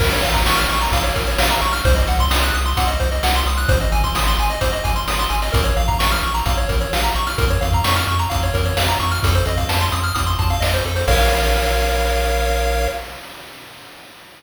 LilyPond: <<
  \new Staff \with { instrumentName = "Lead 1 (square)" } { \time 4/4 \key bes \minor \tempo 4 = 130 bes'16 des''16 f''16 bes''16 des'''16 f'''16 des'''16 bes''16 f''16 des''16 bes'16 des''16 f''16 bes''16 des'''16 f'''16 | c''16 ees''16 ges''16 c'''16 ees'''16 ges'''16 ees'''16 c'''16 ges''16 ees''16 c''16 ees''16 ges''16 c'''16 ees'''16 ges'''16 | c''16 ees''16 aes''16 c'''16 ees'''16 c'''16 aes''16 ees''16 c''16 ees''16 aes''16 c'''16 ees'''16 c'''16 aes''16 ees''16 | bes'16 des''16 f''16 bes''16 des'''16 f'''16 des'''16 bes''16 f''16 des''16 bes'16 des''16 f''16 bes''16 des'''16 f'''16 |
bes'16 des''16 f''16 bes''16 des'''16 f'''16 des'''16 bes''16 f''16 des''16 bes'16 des''16 f''16 bes''16 des'''16 f'''16 | a'16 c''16 ees''16 f''16 a''16 c'''16 ees'''16 f'''16 ees'''16 c'''16 a''16 f''16 ees''16 c''16 a'16 c''16 | <bes' des'' f''>1 | }
  \new Staff \with { instrumentName = "Synth Bass 1" } { \clef bass \time 4/4 \key bes \minor bes,,8 bes,,8 bes,,8 bes,,8 bes,,8 bes,,8 bes,,8 bes,,8 | c,8 c,8 c,8 c,8 c,8 c,8 c,8 c,8 | aes,,8 aes,,8 aes,,8 aes,,8 aes,,8 aes,,8 aes,,8 aes,,8 | bes,,8 bes,,8 bes,,8 bes,,8 bes,,8 bes,,8 bes,,8 bes,,8 |
f,8 f,8 f,8 f,8 f,8 f,8 f,8 f,8 | f,8 f,8 f,8 f,8 f,8 f,8 f,8 f,8 | bes,,1 | }
  \new DrumStaff \with { instrumentName = "Drums" } \drummode { \time 4/4 <cymc bd>16 hh16 hh16 <hh bd>16 sn16 hh16 hh16 hh16 <hh bd>16 hh16 <hh bd>16 hh16 sn16 hh16 hh16 <hh sn>16 | <hh bd>16 hh16 hh16 <hh bd>16 sn16 hh16 hh16 hh16 <hh bd>16 hh16 <hh bd>16 hh16 sn16 hh16 hh16 <hh sn>16 | <hh bd>16 hh16 hh16 <hh bd>16 sn16 hh16 hh16 hh16 <hh bd>16 hh16 <hh bd>16 hh16 sn16 hh16 hh16 <hh sn>16 | <hh bd>16 hh16 hh16 <hh bd>16 sn16 hh16 hh16 hh16 <hh bd>16 hh16 <hh bd>16 hh16 sn16 hh16 hh16 <hh sn>16 |
<hh bd>16 hh16 hh16 <hh bd>16 sn16 hh16 hh16 hh16 <hh bd>16 hh16 <hh bd>16 hh16 sn16 hh16 hh16 <hh sn>16 | <hh bd>16 hh16 hh16 <hh bd>16 sn16 hh16 hh16 hh16 <hh bd>16 hh16 <hh bd>16 hh16 sn16 hh16 hh16 <hh sn>16 | <cymc bd>4 r4 r4 r4 | }
>>